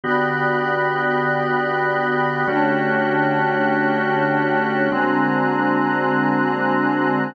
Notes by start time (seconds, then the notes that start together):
0.04 D3 B3 F#4 G4 D5 G5 B5 F#6
2.47 D3 A3 C#4 D4 F#4 G4 C#5 G5 A5 F#6
4.92 D3 G#3 A#3 C4 D4 F#4 C5 G#5 A#5 F#6